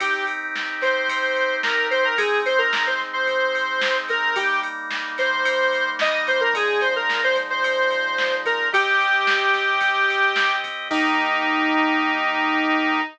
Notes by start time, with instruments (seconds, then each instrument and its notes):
0.00 drawbar organ C4 D#4 G4, lead 1 (square) G4, kick, ride
0.27 ride
0.56 snare
0.81 lead 1 (square) C5, snare, ride
1.09 kick, ride
1.36 ride
1.63 lead 1 (square) A#4, snare
1.91 lead 1 (square) C5, ride
2.05 lead 1 (square) A#4
2.18 drawbar organ G#3 C4 D#4, lead 1 (square) G#4, kick, ride
2.46 lead 1 (square) C5, ride
2.58 lead 1 (square) A#4
2.73 snare
2.87 lead 1 (square) C5
3.00 snare
3.13 lead 1 (square) C5
3.27 kick, ride
3.55 ride
3.81 snare
4.09 lead 1 (square) A#4, kick, ride
4.36 drawbar organ G3 A#3 D#4, lead 1 (square) G4, kick, ride
4.63 ride
4.91 snare
5.18 lead 1 (square) C5, snare, ride
5.45 kick, ride
5.73 ride
5.99 lead 1 (square) D#5, snare
6.27 lead 1 (square) C5, kick, ride
6.41 lead 1 (square) A#4
6.54 drawbar organ A#2 F3 G#3 D#4, lead 1 (square) G#4, kick, ride
6.81 lead 1 (square) C5, ride
6.96 lead 1 (square) A#4
7.10 snare
7.24 lead 1 (square) C5
7.35 snare, ride
7.50 lead 1 (square) C5
7.63 kick, ride
7.91 ride
8.18 snare
8.45 lead 1 (square) A#4, kick, ride
8.72 drawbar organ C4 G4 D#5, lead 1 (square) G4, kick, ride
9.00 ride
9.27 snare
9.53 snare, ride
9.81 kick, ride
10.10 ride
10.36 snare
10.64 kick, ride
10.90 drawbar organ D#3 A#3 G4, lead 1 (square) D#4, kick, crash